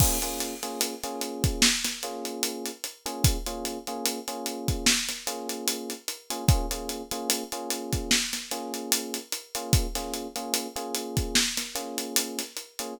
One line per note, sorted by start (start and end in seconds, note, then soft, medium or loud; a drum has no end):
0.00 0.18 A#3 loud
0.00 0.18 C#4 loud
0.00 0.18 F4 loud
0.00 0.18 G#4 loud
0.00 kick medium
0.00 crash medium
0.22 0.54 A#3 loud
0.22 0.54 C#4 loud
0.22 0.54 F4 loud
0.22 0.54 G#4 medium
0.22 closed hi-hat medium
0.40 closed hi-hat medium
0.63 0.94 A#3 medium
0.63 0.94 C#4 medium
0.63 0.94 F4 medium
0.63 0.94 G#4 loud
0.63 closed hi-hat medium
0.81 closed hi-hat medium
1.04 1.67 A#3 medium
1.04 1.67 C#4 loud
1.04 1.67 F4 medium
1.04 1.67 G#4 loud
1.04 closed hi-hat medium
1.21 closed hi-hat medium
1.44 kick medium
1.44 closed hi-hat medium
1.62 snare loud
1.84 snare medium
1.84 closed hi-hat medium
2.03 2.70 A#3 loud
2.03 2.70 C#4 medium
2.03 2.70 F4 loud
2.03 2.70 G#4 loud
2.03 closed hi-hat medium
2.25 closed hi-hat medium
2.43 closed hi-hat medium
2.66 closed hi-hat medium
2.84 closed hi-hat medium
3.06 3.37 A#3 medium
3.06 3.37 C#4 loud
3.06 3.37 F4 medium
3.06 3.37 G#4 loud
3.06 closed hi-hat medium
3.24 kick medium
3.24 closed hi-hat medium
3.46 3.78 A#3 medium
3.46 3.78 C#4 loud
3.46 3.78 F4 loud
3.46 3.78 G#4 loud
3.46 closed hi-hat medium
3.65 closed hi-hat medium
3.87 4.19 A#3 loud
3.87 4.19 C#4 medium
3.87 4.19 F4 medium
3.87 4.19 G#4 loud
3.87 closed hi-hat medium
4.06 closed hi-hat medium
4.28 4.91 A#3 loud
4.28 4.91 C#4 loud
4.28 4.91 F4 loud
4.28 4.91 G#4 medium
4.28 closed hi-hat medium
4.46 closed hi-hat medium
4.68 kick medium
4.68 closed hi-hat medium
4.86 snare medium
5.09 snare soft
5.09 closed hi-hat medium
5.27 5.93 A#3 loud
5.27 5.93 C#4 medium
5.27 5.93 F4 loud
5.27 5.93 G#4 medium
5.27 closed hi-hat medium
5.49 closed hi-hat medium
5.68 closed hi-hat medium
5.90 closed hi-hat medium
6.08 closed hi-hat medium
6.30 6.45 A#3 medium
6.30 6.45 C#4 medium
6.30 6.45 F4 loud
6.30 6.45 G#4 loud
6.30 closed hi-hat medium
6.48 6.66 A#3 loud
6.48 6.66 C#4 loud
6.48 6.66 F4 loud
6.48 6.66 G#4 loud
6.48 kick loud
6.48 closed hi-hat medium
6.71 7.02 A#3 medium
6.71 7.02 C#4 medium
6.71 7.02 F4 medium
6.71 7.02 G#4 loud
6.71 closed hi-hat medium
6.89 closed hi-hat medium
7.11 7.43 A#3 loud
7.11 7.43 C#4 loud
7.11 7.43 F4 loud
7.11 7.43 G#4 loud
7.11 closed hi-hat medium
7.30 closed hi-hat medium
7.52 8.16 A#3 loud
7.52 8.16 C#4 loud
7.52 8.16 F4 loud
7.52 8.16 G#4 medium
7.52 closed hi-hat medium
7.70 closed hi-hat medium
7.93 kick medium
7.93 closed hi-hat medium
8.11 snare medium
8.33 snare soft
8.33 closed hi-hat medium
8.51 9.18 A#3 loud
8.51 9.18 C#4 medium
8.51 9.18 F4 medium
8.51 9.18 G#4 medium
8.51 closed hi-hat medium
8.74 closed hi-hat medium
8.92 closed hi-hat loud
9.14 closed hi-hat medium
9.32 closed hi-hat medium
9.55 9.87 A#3 loud
9.55 9.87 C#4 medium
9.55 9.87 F4 loud
9.55 9.87 G#4 medium
9.55 closed hi-hat medium
9.73 kick medium
9.73 closed hi-hat medium
9.95 10.27 A#3 medium
9.95 10.27 C#4 loud
9.95 10.27 F4 loud
9.95 10.27 G#4 medium
9.95 snare soft
9.95 closed hi-hat medium
10.14 closed hi-hat medium
10.36 10.67 A#3 loud
10.36 10.67 C#4 medium
10.36 10.67 F4 loud
10.36 10.67 G#4 medium
10.36 closed hi-hat medium
10.54 closed hi-hat medium
10.76 11.39 A#3 loud
10.76 11.39 C#4 medium
10.76 11.39 F4 loud
10.76 11.39 G#4 loud
10.76 closed hi-hat medium
10.95 closed hi-hat medium
11.17 kick medium
11.17 closed hi-hat medium
11.35 snare medium
11.57 snare soft
11.57 closed hi-hat medium
11.75 12.42 A#3 loud
11.75 12.42 C#4 loud
11.75 12.42 F4 medium
11.75 12.42 G#4 medium
11.75 closed hi-hat medium
11.98 closed hi-hat medium
12.16 closed hi-hat loud
12.39 snare soft
12.39 closed hi-hat medium
12.57 closed hi-hat medium
12.79 12.94 A#3 loud
12.79 12.94 C#4 medium
12.79 12.94 F4 medium
12.79 12.94 G#4 loud
12.79 closed hi-hat medium